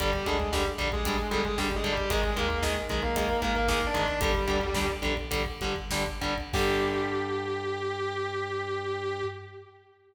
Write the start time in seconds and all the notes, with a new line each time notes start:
0.00 G1 D3 G3 G4, kick, closed hi-hat
0.13 kick
0.26 D2 D3 G3 G#3 G#4, kick, closed hi-hat
0.40 kick
0.53 D3 G3 G4, kick, snare
0.66 kick
0.78 A#1 D3 G3, kick, closed hi-hat
0.92 G#3 G#4, kick
1.05 D3 G3, kick, closed hi-hat
1.19 kick
1.31 G1 D3 G3 G#3 G#4, kick, closed hi-hat
1.44 G#3 G#4, kick
1.58 D3 G3 G4, kick, snare
1.71 kick
1.76 G#3 G#4
1.84 D3 G3, kick, closed hi-hat
1.92 G3 G4
1.97 kick
2.10 G#1 D#3 G#3 G#4, kick, closed hi-hat
2.24 kick
2.36 D#2 D#3 G#3 A#3 A#4, kick, closed hi-hat
2.50 kick
2.63 D#3 G#3 G#4, kick, snare
2.77 kick
2.89 B1 D#3 G#3, kick, closed hi-hat
3.02 A#3 A#4, kick
3.16 D#3 G#3, kick, closed hi-hat
3.29 kick
3.42 G#1 D#3 G#3 A#3 A#4, kick, closed hi-hat
3.55 A#3 A#4, kick
3.68 D#3 G#3 A#3 A#4, kick, snare
3.82 kick
3.87 D4 D5
3.94 D#3 G#3, kick, closed hi-hat
4.02 D4 D5
4.08 kick
4.21 G1 D3 G3 G4, kick, closed hi-hat
4.35 kick
4.48 D2 D3 G3, kick, closed hi-hat
4.61 kick
4.74 D3 G3, kick, snare
4.89 kick
5.02 A#1 D3 G3, kick, closed hi-hat
5.17 kick
5.31 D3 G3, kick, closed hi-hat
5.46 kick
5.61 G1 D3 G3, kick, closed hi-hat
5.76 kick
5.91 D3 G3, kick, snare
6.07 kick
6.21 D3 G3, kick, closed hi-hat
6.38 kick
6.53 G2 D3 G3 G4, kick, crash